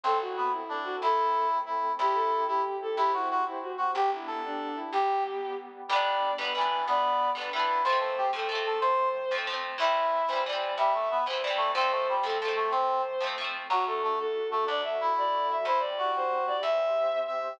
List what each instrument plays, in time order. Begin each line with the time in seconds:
0.04 electric bass (finger) A1, brass section C4, pad 2 (warm) C4 E4 A4, violin A4
0.21 violin F#4
0.37 brass section B3
0.51 violin E4
0.69 brass section D4
0.84 violin F#4
1.01 electric bass (finger) A1, pad 2 (warm) A3 C4 A4, brass section E4, violin A4
1.66 brass section E4
1.99 electric bass (finger) C2, pad 2 (warm) C4 E4 G4, brass section E4, violin G4
2.15 violin A4
2.47 brass section E4, violin G4
2.82 violin A4
2.97 electric bass (finger) C2, pad 2 (warm) C4 G4 C5, brass section E4, violin G4
3.13 violin E4, brass section F#4
3.31 brass section F#4
3.45 violin E4
3.62 violin F#4
3.78 brass section F#4
3.93 electric bass (finger) G1, pad 2 (warm) B3 D4 G4, violin G4, brass section G4
4.13 violin E4
4.27 brass section A4
4.45 violin D4
4.75 violin E4
4.92 electric bass (finger) G1, pad 2 (warm) G3 B3 G4, violin G4, brass section G4
5.88 electric bass (finger) G1, brass section G3, pad 2 (warm) G3 B3 D4, orchestral harp G3, violin D5
5.93 orchestral harp B3 D4
6.38 electric bass (finger) G1, orchestral harp G3 B3, violin B4
6.45 orchestral harp D4
6.54 brass section E3, orchestral harp G3, violin B4
6.58 orchestral harp B3 D4
6.87 electric bass (finger) D2, brass section B3, violin D5
7.35 electric bass (finger) G1, orchestral harp G3 B3, violin B4
7.41 orchestral harp D4
7.53 orchestral harp G3 B3, brass section E4, violin B4
7.59 orchestral harp D4
7.84 electric bass (finger) F2, pad 2 (warm) F3 A3 C4, orchestral harp F3, brass section C5, violin C5
7.90 orchestral harp A3 C4
8.00 brass section A4
8.18 brass section G4
8.33 electric bass (finger) F2, orchestral harp F3 A3, violin A4
8.39 orchestral harp C4
8.49 orchestral harp F3 A3, violin A4
8.55 orchestral harp C4
8.66 brass section A4
8.81 electric bass (finger) C3, brass section C5, violin C5
9.31 electric bass (finger) F2, orchestral harp F3 A3
9.38 orchestral harp C4
9.47 orchestral harp F3 A3
9.53 orchestral harp C4
9.78 electric bass (finger) C2, orchestral harp E3 G3, pad 2 (warm) E3 G3 C4, brass section E4, violin E5
9.84 orchestral harp C4
10.28 electric bass (finger) C2, orchestral harp E3, violin C5
10.33 orchestral harp G3 C4
10.46 orchestral harp E3 G3, violin D5
10.53 orchestral harp C4
10.78 electric bass (finger) G2, brass section G3, violin E5
10.94 brass section A3
11.11 brass section B3
11.26 electric bass (finger) C2, orchestral harp E3 G3, violin C5
11.33 orchestral harp C4
11.43 orchestral harp E3 G3, violin D5
11.50 orchestral harp C4
11.57 brass section A3
11.73 electric bass (finger) F2, orchestral harp F3, pad 2 (warm) F3 A3 C4, brass section C4, violin C5
11.78 orchestral harp A3 C4
11.91 brass section A3
12.09 brass section G3
12.23 electric bass (finger) F2, orchestral harp F3 A3, violin A4
12.30 orchestral harp C4
12.42 orchestral harp F3 A3, violin A4
12.48 orchestral harp C4
12.56 brass section A3
12.71 electric bass (finger) C3, brass section C4, violin C5
13.21 electric bass (finger) F2, orchestral harp F3 A3
13.27 orchestral harp C4
13.38 orchestral harp F3 A3
13.44 orchestral harp C4
13.69 electric bass (finger) D2, brass section F#3, pad 2 (warm) A3 D4 F#4, violin F#4
13.87 brass section A3, violin A4
14.04 brass section A3
14.19 violin A4
14.50 brass section A3, violin A4
14.67 electric bass (finger) D2, pad 2 (warm) A3 F#4 A4, brass section D4, violin D5
14.84 violin E5
15.01 brass section E4
15.18 violin D5
15.51 violin E5
15.65 electric bass (finger) E2, pad 2 (warm) C4 E4 G4, brass section E4, violin C5
15.79 violin D5
15.98 brass section F#4
16.16 violin C5
16.47 violin D5
16.62 electric bass (finger) E2, pad 2 (warm) C4 G4 C5, brass section E5, violin E5
17.27 brass section E5